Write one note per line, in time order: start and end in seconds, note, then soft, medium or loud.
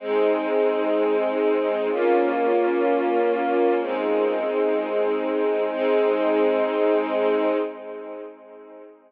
0.00 1.88 G#3 loud
0.00 1.88 C4 loud
0.00 1.88 D#4 loud
1.91 3.79 A#3 medium
1.91 3.79 C#4 loud
1.91 3.79 F4 medium
3.81 5.70 G#3 medium
3.81 5.70 C4 medium
3.81 5.70 D#4 medium
5.71 7.55 G#3 loud
5.71 7.55 C4 loud
5.71 7.55 D#4 loud